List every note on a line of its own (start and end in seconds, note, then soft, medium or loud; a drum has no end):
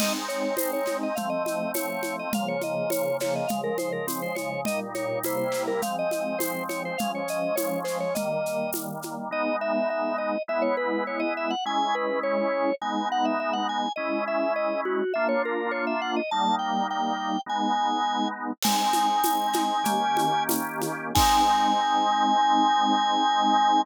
0.00 1.14 G#3 medium
0.00 1.14 C4 medium
0.00 1.14 D#4 medium
0.00 0.13 D#5 medium
0.00 crash medium
0.00 low conga medium
0.00 shaker medium
0.28 0.55 C#5 medium
0.28 shaker medium
0.57 0.71 C5 medium
0.57 tambourine medium
0.57 high conga medium
0.57 shaker medium
0.73 0.97 C#5 medium
0.86 snare soft
0.86 high conga medium
0.86 shaker medium
1.03 1.17 D#5 medium
1.15 2.31 F3 medium
1.15 2.31 A3 medium
1.15 2.31 C4 medium
1.15 1.29 F5 medium
1.15 low conga medium
1.15 shaker medium
1.30 1.43 D#5 medium
1.45 1.71 D#5 medium
1.45 high conga medium
1.45 shaker medium
1.74 2.02 C#5 medium
1.74 tambourine medium
1.74 high conga medium
1.74 shaker medium
2.02 2.16 C#5 medium
2.02 high conga medium
2.02 shaker medium
2.19 2.33 D#5 medium
2.32 3.46 C#3 medium
2.32 3.46 F3 medium
2.32 3.46 A#3 medium
2.32 2.48 F5 medium
2.32 low conga loud
2.32 shaker medium
2.48 2.62 C#5 medium
2.61 2.90 D#5 medium
2.61 high conga medium
2.61 shaker medium
2.90 3.17 C#5 medium
2.90 tambourine medium
2.90 high conga medium
2.90 shaker medium
3.20 3.35 C#5 medium
3.20 snare medium
3.20 high conga medium
3.20 shaker medium
3.36 3.49 D#5 medium
3.47 4.65 C#3 medium
3.47 4.65 F3 medium
3.47 4.65 G#3 medium
3.47 3.61 F5 medium
3.47 low conga medium
3.47 shaker medium
3.64 3.77 A#4 medium
3.78 3.92 C5 medium
3.78 high conga medium
3.78 shaker medium
3.92 4.06 A#4 medium
4.07 4.21 C4 medium
4.07 tambourine medium
4.07 high conga medium
4.07 shaker medium
4.22 4.36 C5 medium
4.35 4.61 C#5 medium
4.35 high conga medium
4.35 shaker medium
4.65 5.23 A#2 medium
4.65 5.23 G3 medium
4.65 5.23 D#4 medium
4.65 4.80 D#5 medium
4.65 low conga medium
4.65 shaker medium
4.95 5.19 C#5 medium
4.95 high conga medium
4.95 shaker medium
5.23 5.81 C3 medium
5.23 5.81 G3 medium
5.23 5.81 A#3 medium
5.23 5.81 E4 medium
5.23 5.37 C5 medium
5.23 tambourine medium
5.23 high conga medium
5.23 shaker medium
5.37 5.63 C5 medium
5.52 snare medium
5.52 shaker medium
5.67 5.81 A#4 medium
5.81 6.96 F3 medium
5.81 6.96 G#3 medium
5.81 6.96 C4 medium
5.81 5.96 F5 medium
5.81 low conga medium
5.81 shaker medium
5.99 6.11 D#5 medium
6.11 6.38 D#5 medium
6.11 high conga medium
6.11 shaker medium
6.39 6.63 C5 medium
6.39 tambourine medium
6.39 high conga medium
6.39 shaker medium
6.69 6.83 C#5 medium
6.69 high conga medium
6.69 shaker medium
6.85 6.99 C5 medium
6.98 8.15 F3 medium
6.98 8.15 G#3 medium
6.98 8.15 C#4 medium
6.98 7.12 F5 medium
6.98 low conga medium
6.98 shaker medium
7.15 7.29 C#5 medium
7.28 7.55 D#5 medium
7.28 shaker medium
7.56 7.80 C#5 medium
7.56 tambourine medium
7.56 high conga medium
7.56 shaker medium
7.84 7.98 C5 medium
7.84 snare soft
7.84 shaker medium
8.00 8.14 C#5 medium
8.15 9.29 D#3 medium
8.15 9.29 G3 medium
8.15 9.29 A#3 medium
8.15 8.71 D#5 medium
8.15 low conga medium
8.15 shaker medium
8.46 shaker medium
8.73 tambourine medium
8.73 high conga medium
8.73 shaker medium
9.02 high conga medium
9.02 shaker medium
9.31 10.36 G#3 medium
9.31 10.36 B3 medium
9.31 10.36 D#4 medium
9.31 9.56 D#5 medium
9.61 9.89 E5 medium
9.90 10.17 E5 medium
10.18 10.42 D#5 medium
10.48 11.53 G#3 medium
10.48 11.53 B3 medium
10.48 11.53 E4 medium
10.48 10.63 E5 medium
10.62 10.76 C#5 medium
10.77 11.04 B4 medium
11.07 11.21 C#5 medium
11.20 11.33 D#5 medium
11.37 11.51 E5 medium
11.50 11.64 F#5 medium
11.65 12.70 G#3 loud
11.65 12.70 C#4 medium
11.65 12.70 E4 medium
11.65 11.95 G#5 medium
11.95 12.19 B4 medium
12.23 12.75 C#5 medium
12.82 13.86 G#3 medium
12.82 13.86 B3 medium
12.82 13.86 D#4 medium
12.82 13.08 G#5 medium
13.12 13.26 F#5 medium
13.25 13.39 E5 medium
13.40 13.54 E5 medium
13.53 13.67 F#5 medium
13.69 13.92 G#5 medium
13.96 15.02 G#3 medium
13.96 15.02 C#4 medium
13.96 15.02 E4 medium
13.96 14.24 D#5 medium
14.28 14.53 E5 medium
14.56 14.81 D#5 medium
14.85 15.13 F#4 medium
15.14 16.20 A#3 medium
15.14 16.20 D4 medium
15.14 16.20 F4 medium
15.14 15.27 E5 medium
15.29 15.42 C#5 medium
15.45 15.71 A#4 medium
15.71 15.85 C#5 medium
15.87 16.01 E5 medium
16.02 16.15 F#5 medium
16.16 16.30 D#5 medium
16.31 17.37 G3 medium
16.31 17.37 A#3 medium
16.31 17.37 D#4 medium
16.31 16.55 A5 medium
16.59 16.87 G5 medium
16.90 17.41 G5 medium
17.46 18.51 G#3 medium
17.46 18.51 B3 medium
17.46 18.51 D#4 medium
17.46 18.28 G#5 medium
18.62 19.83 G#3 medium
18.62 19.83 C4 medium
18.62 19.83 D#4 medium
18.62 20.43 G#5 medium
18.62 crash loud
18.62 low conga loud
18.62 shaker medium
18.93 high conga medium
18.93 shaker medium
19.24 tambourine medium
19.24 high conga medium
19.24 shaker medium
19.53 snare medium
19.53 high conga medium
19.53 shaker medium
19.84 21.12 D#3 medium
19.84 21.12 A#3 medium
19.84 21.12 C#4 medium
19.84 21.12 G4 medium
19.84 low conga medium
19.84 shaker medium
20.17 high conga medium
20.17 shaker medium
20.49 tambourine medium
20.49 high conga medium
20.49 shaker medium
20.81 high conga medium
20.81 shaker medium
21.15 23.82 G#3 loud
21.15 23.82 C4 loud
21.15 23.82 D#4 loud
21.15 23.82 G#5 loud
21.15 kick loud
21.15 crash loud